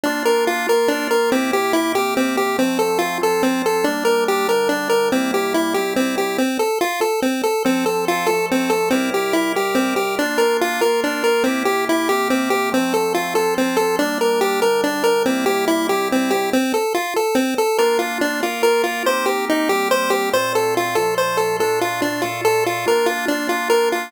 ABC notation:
X:1
M:3/4
L:1/8
Q:1/4=142
K:F
V:1 name="Lead 1 (square)"
D B F B D B | C G E G C G | C A F A C A | D B G B D B |
C G E G C G | C A F A C A | C A F A C A | C G E G C G |
D B F B D B | C G E G C G | C A F A C A | D B G B D B |
C G E G C G | C A F A C A | [K:Bb] B F D F B F | c G E G c G |
c A F A c A | A F D F A F | B F D F B F |]
V:2 name="Drawbar Organ"
[B,DF]3 [B,FB]3 | [C,B,EG]3 [C,B,CG]3 | [F,A,C]3 [F,CF]3 | [G,B,D]3 [D,G,D]3 |
[C,G,B,E]3 [C,G,CE]3 | z6 | [F,CA]3 [F,A,A]3 | [C,G,EB]3 [C,G,GB]3 |
[B,DF]3 [B,FB]3 | [C,B,EG]3 [C,B,CG]3 | [F,A,C]3 [F,CF]3 | [G,B,D]3 [D,G,D]3 |
[C,G,B,E]3 [C,G,CE]3 | z6 | [K:Bb] [B,DF]3 [B,FB]3 | [B,CEG]3 [G,B,CG]3 |
[B,,A,CF]3 [B,,F,A,F]3 | [B,,A,DF]3 [B,,A,FA]3 | [B,DF]6 |]